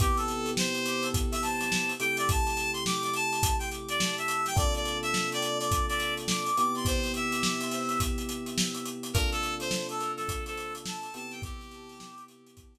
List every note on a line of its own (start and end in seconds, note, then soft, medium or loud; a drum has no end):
0.00 1.92 C3 medium
0.00 1.92 B3 medium
0.00 1.92 E4 medium
0.00 1.92 G4 medium
0.00 0.17 G4 medium
0.00 kick medium
0.00 closed hi-hat medium
0.17 0.50 A4 medium
0.17 closed hi-hat medium
0.28 closed hi-hat medium
0.46 closed hi-hat medium
0.57 1.09 C5 medium
0.57 snare loud
0.74 closed hi-hat medium
0.86 closed hi-hat medium
1.03 closed hi-hat medium
1.14 kick medium
1.14 closed hi-hat medium
1.32 1.42 E5 medium
1.32 closed hi-hat medium
1.42 1.92 A5 medium
1.42 snare soft
1.42 closed hi-hat medium
1.61 snare soft
1.61 closed hi-hat medium
1.72 snare medium
1.89 closed hi-hat medium
2.00 4.54 C3 medium
2.00 4.54 A3 medium
2.00 4.54 E4 medium
2.00 4.54 G4 medium
2.00 2.17 G5 medium
2.00 closed hi-hat medium
2.17 2.28 D5 medium
2.17 closed hi-hat medium
2.29 2.71 A5 medium
2.29 kick medium
2.29 closed hi-hat medium
2.47 snare soft
2.47 closed hi-hat medium
2.57 closed hi-hat medium
2.73 2.84 C6 medium
2.73 closed hi-hat medium
2.86 3.03 D6 medium
2.86 snare medium
3.03 3.14 D6 medium
3.03 snare soft
3.03 closed hi-hat medium
3.14 3.56 A5 medium
3.14 closed hi-hat medium
3.33 closed hi-hat medium
3.43 kick medium
3.43 closed hi-hat loud
3.59 3.70 G5 medium
3.59 closed hi-hat medium
3.71 closed hi-hat medium
3.88 4.16 D5 medium
3.88 closed hi-hat medium
4.00 snare loud
4.18 4.46 E5 medium
4.18 closed hi-hat medium
4.28 closed hi-hat medium
4.46 4.57 G5 medium
4.46 snare soft
4.46 closed hi-hat medium
4.56 6.48 C3 medium
4.56 6.48 A#3 medium
4.56 6.48 D4 medium
4.56 6.48 F4 medium
4.56 6.48 A4 medium
4.56 4.74 D5 medium
4.56 kick medium
4.56 closed hi-hat medium
4.74 4.98 D5 medium
4.74 closed hi-hat medium
4.85 closed hi-hat medium
5.03 5.30 E5 medium
5.03 closed hi-hat medium
5.14 snare medium
5.32 5.58 D5 medium
5.32 closed hi-hat medium
5.42 closed hi-hat medium
5.59 5.86 D5 medium
5.59 closed hi-hat medium
5.71 kick medium
5.71 closed hi-hat medium
5.88 6.14 D5 medium
5.88 closed hi-hat medium
6.00 closed hi-hat medium
6.17 closed hi-hat medium
6.28 6.57 D6 medium
6.28 snare medium
6.46 closed hi-hat medium
6.57 9.11 C3 medium
6.57 9.11 B3 medium
6.57 9.11 E4 medium
6.57 9.11 G4 medium
6.57 6.75 D6 medium
6.57 closed hi-hat medium
6.75 6.86 C6 medium
6.75 closed hi-hat medium
6.85 7.12 C5 medium
6.85 kick medium
6.85 closed hi-hat medium
7.03 snare soft
7.03 closed hi-hat medium
7.14 8.00 E5 medium
7.14 closed hi-hat medium
7.32 closed hi-hat medium
7.43 snare medium
7.61 closed hi-hat medium
7.71 closed hi-hat medium
7.89 closed hi-hat medium
8.00 kick medium
8.00 closed hi-hat medium
8.18 closed hi-hat medium
8.29 closed hi-hat medium
8.46 closed hi-hat medium
8.58 snare loud
8.75 closed hi-hat medium
8.85 closed hi-hat medium
9.03 closed hi-hat medium
9.13 11.07 C3 medium
9.13 11.07 A#3 medium
9.13 11.07 D4 medium
9.13 11.07 F4 medium
9.13 11.07 A4 medium
9.13 9.30 A#4 medium
9.13 kick medium
9.13 closed hi-hat medium
9.32 9.55 A4 medium
9.32 closed hi-hat medium
9.43 closed hi-hat medium
9.60 9.87 C5 medium
9.60 closed hi-hat medium
9.71 snare loud
9.89 10.12 A4 medium
9.89 closed hi-hat medium
10.00 closed hi-hat medium
10.17 10.44 A4 medium
10.17 snare soft
10.17 closed hi-hat medium
10.29 kick medium
10.29 closed hi-hat medium
10.46 10.74 A4 medium
10.46 closed hi-hat medium
10.57 closed hi-hat medium
10.75 closed hi-hat medium
10.85 11.13 A5 medium
10.85 snare loud
11.03 closed hi-hat medium
11.14 12.78 C3 medium
11.14 12.78 B3 medium
11.14 12.78 E4 medium
11.14 12.78 G4 medium
11.14 11.32 A5 medium
11.14 closed hi-hat medium
11.31 11.42 G5 medium
11.31 snare soft
11.31 closed hi-hat medium
11.42 12.24 G4 medium
11.42 kick loud
11.42 closed hi-hat medium
11.60 snare soft
11.60 closed hi-hat medium
11.71 closed hi-hat medium
11.89 closed hi-hat medium
12.00 snare medium
12.18 closed hi-hat medium
12.28 closed hi-hat medium
12.46 closed hi-hat medium
12.57 kick medium
12.57 closed hi-hat medium
12.75 closed hi-hat medium